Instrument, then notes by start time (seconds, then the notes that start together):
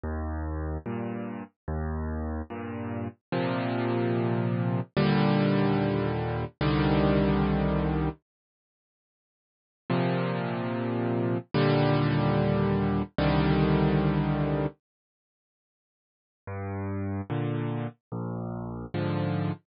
acoustic grand piano
0.04 D#2
0.86 G2 A#2
1.68 D#2
2.50 G2 A#2
3.32 A#2 C3 F3
4.97 D#2 A#2 D3 G3
6.61 C2 D3 D#3 G3
9.90 A#2 C3 F3
11.54 D#2 A#2 D3 G3
13.18 C2 D3 D#3 G3
16.47 G2
17.30 A#2 D3
18.12 A#1
18.94 G#2 D3 F3